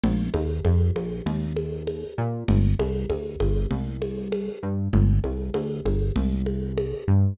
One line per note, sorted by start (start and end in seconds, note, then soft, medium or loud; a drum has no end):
0.03 0.29 A#1 loud
0.03 low conga medium
0.34 0.60 D#2 medium
0.34 high conga medium
0.65 0.91 F2 medium
0.65 high conga medium
0.95 1.21 A#1 medium
0.95 high conga medium
1.26 2.04 D#2 medium
1.26 low conga medium
1.57 high conga medium
1.87 high conga medium
2.18 2.44 A#2 medium
2.48 2.74 G1 medium
2.48 low conga medium
2.79 3.05 C2 medium
2.79 high conga medium
3.10 3.36 D2 medium
3.10 high conga medium
3.40 3.66 G1 medium
3.40 high conga medium
3.71 4.49 C2 medium
3.71 low conga medium
4.02 high conga medium
4.32 high conga medium
4.63 4.89 G2 medium
4.93 5.20 G1 loud
4.93 low conga medium
5.24 5.50 C2 medium
5.24 high conga medium
5.54 5.81 D2 medium
5.54 high conga medium
5.85 6.11 G1 medium
5.85 high conga medium
6.16 6.94 C2 medium
6.16 low conga medium
6.46 high conga medium
6.78 high conga medium
7.08 7.34 G2 medium